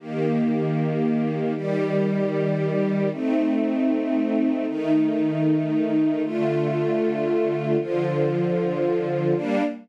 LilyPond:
\new Staff { \time 4/4 \key g \minor \tempo 4 = 77 <ees bes g'>2 <ees g g'>2 | <a c' ees'>2 <ees a ees'>2 | <d a f'>2 <d f f'>2 | <g bes d'>4 r2. | }